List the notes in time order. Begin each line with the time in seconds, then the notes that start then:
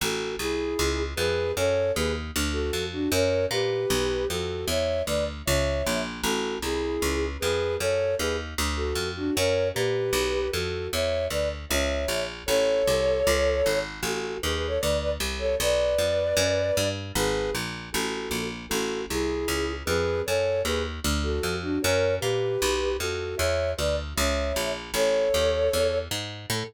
0.01 A1 F#4 A4
0.39 C2 E4 G#4
0.79 C#2
1.16 F2 G#4 B4
1.56 F#2 A4 C#5
1.95 D#2 G#4 B4
2.36 D2
2.53 F#4 A4
2.73 F2
2.92 D4 F#4
3.12 F#2 A#4 C#5
3.51 A#2 G4 B4
3.90 B1
4.29 F2 F#4 A4
4.68 E2 C#5 E5
5.06 D2 B4 D5
5.45 C#2 C#5 E5
5.86 A#1
6.23 A1 F#4 A4
6.62 C2 E4 G#4
7.02 C#2
7.40 F2 G#4 B4
7.79 F#2 A4 C#5
8.18 D#2 G#4 B4
8.58 D2
8.76 F#4 A4
8.95 F2
9.16 D4 F#4
9.35 F#2 A#4 C#5
9.74 A#2 G4 B4
10.13 B1
10.51 F2 F#4 A4
10.92 E2 C#5 E5
11.30 D2 B4 D5
11.69 C#2 C#5 E5
12.08 A#1
12.46 A1 A4 C#5
12.87 C2
13.27 C#2
13.66 G#1
14.02 A1 F#4 A4
14.42 D#2 G#4 B4
14.54 G#4 B4
14.67 A4 C#5
14.80 D2 B4 D5
15.01 B4 D5
15.20 C2
15.39 A4 C#5
15.60 B1 B4 D5
15.98 F2
16.37 F#2
16.77 G2
17.15 G#1 G#4 B4
17.55 A#1
17.92 A1 F#4 A4
18.31 A#1
18.69 A1 F#4 A4
19.10 C2 E4 G#4
19.48 C#2
19.85 F2 G#4 B4
20.26 F#2 A4 C#5
20.65 D#2 G#4 B4
21.04 D2
21.23 F#4 A4
21.43 F2
21.62 D4 F#4
21.82 F#2 A#4 C#5
22.20 A#2 G4 B4
22.62 B1
22.99 F2 F#4 A4
23.37 E2 C#5 E5
23.77 D2 B4 D5
24.16 C#2 C#5 E5
24.56 A#1
24.94 A1 A4 C#5
25.34 D#2
25.73 E2
26.11 G#2
26.50 A2 A4